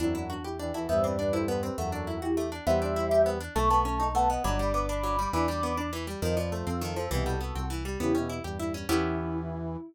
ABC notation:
X:1
M:6/8
L:1/8
Q:3/8=135
K:Em
V:1 name="Ocarina"
[CE] [DF] [DF] [EG]2 [FA] | [ce] [Bd] [Bd] [Ac]2 [GB] | [FA]3 [EG]2 z | [ce]4 z2 |
[a^c'] [ac']3 [fa] [^df] | [bd']3 [bd']3 | [bd']4 z2 | [c_e] [Bd] [Ac] [=FA]3 |
[EG] [FA]3 z2 | [EG]2 z4 | E6 |]
V:2 name="Brass Section"
[F,,F,]3 z [E,,E,] [E,,E,] | [G,,G,]6 | [F,,F,]3 z3 | [G,G]6 |
[A,A]4 [B,B]2 | [Dd]6 | [Dd]3 z3 | [=F,=F]6 |
[B,,B,]2 z4 | [^C,^C] [B,,B,]2 [G,,G,]3 | E,6 |]
V:3 name="Orchestral Harp"
D E F G D E | B, C D E B, C | A, D E F A, D | B, D E G B, D |
A, B, ^C ^D A, B, | F, G, B, D F, G, | E, G, B, D E, G, | _E, =F, A, C E, F, |
E, G, B, C E, G, | B, ^C E G E C | [B,^CEG]6 |]
V:4 name="Synth Bass 1" clef=bass
E,,6 | E,,6 | E,,6 | E,,6 |
B,,,6 | G,,,6 | E,,6 | =F,,3 F,,3 |
C,,3 C,,3 | E,,3 E,,3 | E,,6 |]